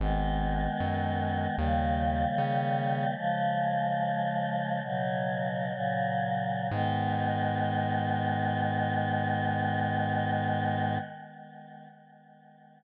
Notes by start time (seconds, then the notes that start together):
0.00 G#1 D#3 G#3 B3
0.80 F#2
1.57 D#2 C#3 D#3 G3 A#3
2.38 C#3
3.16 C#3 F3 G#3
4.83 B2 C#3 F#3
5.72 A#2 C#3 F#3
6.70 G#2 D#3 G#3 B3